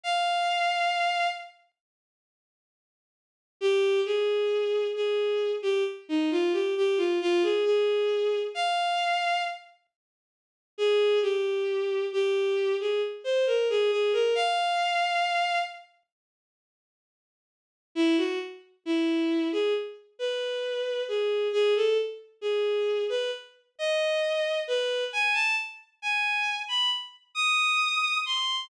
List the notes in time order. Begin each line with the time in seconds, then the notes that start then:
0.04 F5
3.61 G4
4.06 G#4
4.96 G#4
5.62 G4
6.09 D#4
6.31 F4
6.53 G4
6.77 G4
6.98 F4
7.21 F4
7.43 G#4
7.65 G#4
8.55 F5
10.78 G#4
11.22 G4
12.13 G4
12.80 G#4
13.24 C5
13.47 A#4
13.70 G#4
13.91 G#4
14.13 A#4
14.35 F5
17.95 E4
18.18 F#4
18.86 E4
19.53 G#4
20.19 B4
21.08 G#4
21.53 G#4
21.76 A4
22.41 G#4
23.10 B4
23.79 D#5
24.68 B4
25.13 G#5
25.34 A5
26.02 G#5
26.68 B5
27.35 D#6
28.26 C6